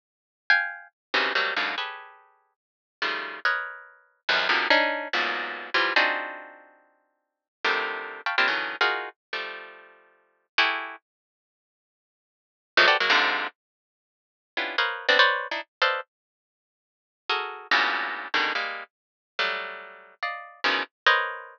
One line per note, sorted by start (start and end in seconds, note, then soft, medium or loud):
0.50 0.88 F5 loud
0.50 0.88 G5 loud
0.50 0.88 G#5 loud
1.14 1.33 C3 medium
1.14 1.33 C#3 medium
1.14 1.33 D#3 medium
1.14 1.33 E3 medium
1.14 1.33 F3 medium
1.14 1.33 F#3 medium
1.35 1.54 F#3 medium
1.35 1.54 G3 medium
1.35 1.54 A3 medium
1.35 1.54 A#3 medium
1.35 1.54 C4 medium
1.56 1.75 F#2 medium
1.56 1.75 G#2 medium
1.56 1.75 A#2 medium
1.56 1.75 B2 medium
1.56 1.75 C#3 medium
1.56 1.75 D3 medium
1.78 2.53 G4 soft
1.78 2.53 G#4 soft
1.78 2.53 A4 soft
1.78 2.53 B4 soft
1.78 2.53 C#5 soft
3.02 3.40 C#3 medium
3.02 3.40 D#3 medium
3.02 3.40 F3 medium
3.02 3.40 G3 medium
3.02 3.40 A3 medium
3.45 4.21 A#4 medium
3.45 4.21 B4 medium
3.45 4.21 C#5 medium
3.45 4.21 D#5 medium
4.29 4.48 E2 medium
4.29 4.48 F2 medium
4.29 4.48 F#2 medium
4.49 4.68 B2 medium
4.49 4.68 C3 medium
4.49 4.68 D3 medium
4.49 4.68 D#3 medium
4.49 4.68 F3 medium
4.70 5.08 C#4 loud
4.70 5.08 D4 loud
4.70 5.08 D#4 loud
5.13 5.70 E2 medium
5.13 5.70 F#2 medium
5.13 5.70 G#2 medium
5.13 5.70 A#2 medium
5.13 5.70 B2 medium
5.74 5.93 E3 medium
5.74 5.93 F3 medium
5.74 5.93 G3 medium
5.96 7.47 C4 medium
5.96 7.47 D4 medium
5.96 7.47 D#4 medium
5.96 7.47 F4 medium
5.96 7.47 F#4 medium
5.96 7.47 G#4 medium
7.65 8.21 C3 medium
7.65 8.21 D3 medium
7.65 8.21 D#3 medium
7.65 8.21 F3 medium
7.65 8.21 G3 medium
7.65 8.21 A3 medium
8.26 8.36 F5 medium
8.26 8.36 G5 medium
8.26 8.36 A5 medium
8.26 8.36 B5 medium
8.26 8.36 C#6 medium
8.38 8.47 A#3 medium
8.38 8.47 C4 medium
8.38 8.47 D4 medium
8.38 8.47 E4 medium
8.38 8.47 F4 medium
8.38 8.47 G4 medium
8.48 8.76 C#3 medium
8.48 8.76 D3 medium
8.48 8.76 D#3 medium
8.48 8.76 E3 medium
8.48 8.76 F#3 medium
8.81 9.09 D#4 medium
8.81 9.09 F4 medium
8.81 9.09 F#4 medium
8.81 9.09 G#4 medium
8.81 9.09 A#4 medium
9.33 10.46 F3 medium
9.33 10.46 G3 medium
9.33 10.46 A3 medium
10.58 10.96 E4 loud
10.58 10.96 F#4 loud
10.58 10.96 G4 loud
10.58 10.96 G#4 loud
10.58 10.96 A4 loud
12.77 12.87 E3 loud
12.77 12.87 F3 loud
12.77 12.87 F#3 loud
12.77 12.87 G#3 loud
12.77 12.87 A3 loud
12.88 12.97 F#4 medium
12.88 12.97 G4 medium
12.88 12.97 A4 medium
12.88 12.97 B4 medium
12.88 12.97 C5 medium
12.88 12.97 D5 medium
13.00 13.10 F#3 medium
13.00 13.10 G#3 medium
13.00 13.10 A#3 medium
13.10 13.47 G#2 loud
13.10 13.47 A#2 loud
13.10 13.47 C3 loud
13.10 13.47 D3 loud
14.57 14.76 B3 medium
14.57 14.76 C#4 medium
14.57 14.76 D4 medium
14.57 14.76 E4 medium
14.57 14.76 F4 medium
14.57 14.76 G4 medium
14.78 15.06 A#4 medium
14.78 15.06 B4 medium
14.78 15.06 C5 medium
14.78 15.06 C#5 medium
14.78 15.06 D#5 medium
14.78 15.06 F5 medium
15.09 15.18 B3 loud
15.09 15.18 C4 loud
15.09 15.18 D4 loud
15.19 15.47 B4 loud
15.19 15.47 C5 loud
15.19 15.47 C#5 loud
15.19 15.47 D5 loud
15.51 15.61 D4 medium
15.51 15.61 D#4 medium
15.51 15.61 E4 medium
15.82 16.01 A4 medium
15.82 16.01 B4 medium
15.82 16.01 C5 medium
15.82 16.01 D5 medium
15.82 16.01 D#5 medium
15.82 16.01 F5 medium
17.29 17.67 F#4 medium
17.29 17.67 G#4 medium
17.29 17.67 A4 medium
17.29 17.67 A#4 medium
17.71 18.28 G2 medium
17.71 18.28 A2 medium
17.71 18.28 A#2 medium
17.71 18.28 B2 medium
17.71 18.28 C#3 medium
18.34 18.53 B2 medium
18.34 18.53 C#3 medium
18.34 18.53 D3 medium
18.34 18.53 D#3 medium
18.55 18.83 G3 medium
18.55 18.83 G#3 medium
18.55 18.83 A#3 medium
19.39 20.15 F#3 medium
19.39 20.15 G3 medium
19.39 20.15 A3 medium
20.23 20.60 D5 medium
20.23 20.60 D#5 medium
20.23 20.60 F5 medium
20.64 20.83 B2 medium
20.64 20.83 C#3 medium
20.64 20.83 D#3 medium
20.64 20.83 E3 medium
20.64 20.83 F3 medium
21.06 21.59 A#4 medium
21.06 21.59 B4 medium
21.06 21.59 C5 medium
21.06 21.59 C#5 medium
21.06 21.59 D#5 medium